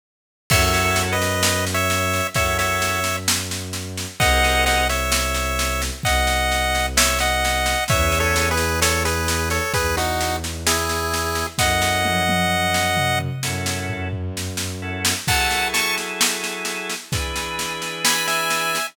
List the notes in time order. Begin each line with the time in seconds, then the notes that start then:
0.50 F#2 C#4 E4 F#4 A4 C#5 E5, kick, snare, crash
0.74 snare
0.96 snare
1.13 B4 D#5
1.22 snare
1.43 snare
1.67 snare
1.74 C#5 E5
1.90 snare
2.13 snare
2.34 F#2 C#4 E4 F#4 A4 C#5 E5, kick, snare
2.59 C#5 E5, snare
2.82 snare
3.04 snare
3.28 snare
3.51 snare
3.73 snare
3.98 snare
4.20 C2 C4 F#4 G#4 A#4 D#5 F#5, kick, snare
4.44 snare
4.66 D#5 F#5, snare
4.89 C#5 E5, snare
5.12 snare
5.34 snare
5.59 snare
5.82 snare
6.03 C2 D#5 F#5, kick, snare
6.27 snare
6.52 snare
6.75 snare
6.97 C#5 E5, snare
7.19 D#5 F#5, snare
7.45 snare
7.66 snare
7.88 E2 B3 C#4 E4 G#4 C#5 E5, kick, snare
8.12 snare
8.20 A4 C#5
8.36 snare
8.51 G#4 B4
8.57 snare
8.82 A4 C#5, snare
9.05 G#4 B4, snare
9.28 snare
9.50 A4 C#5, snare
9.74 E2 G#4 B4, kick, snare
9.97 D#4 F#4, snare
10.21 snare
10.44 snare
10.67 E4 G#4, snare
10.89 snare
11.14 snare
11.35 snare
11.58 F#2 C#4 E4 F#4 A4 D#5 F#5, kick, snare
11.82 snare
12.05 high tom
12.29 high tom
12.74 snare
12.97 mid tom
13.20 mid tom
13.43 F#2 C#4 E4 F#4 A4, snare
13.66 snare
13.90 floor tom
14.13 floor tom
14.37 snare
14.57 snare
14.82 C#4 E4 F#4 A4
15.05 snare
15.28 F#3 E4 G#4 A4 F#5 A5, kick, snare, crash
15.51 snare
15.74 A5 C#6, snare
15.98 snare
16.21 snare
16.44 snare
16.65 snare
16.89 snare
17.12 E3 D4 G#4 B4, kick, snare
17.36 snare
17.59 snare
17.82 snare
18.05 G#5 B5, snare
18.28 E5 G#5, snare
18.50 snare
18.75 snare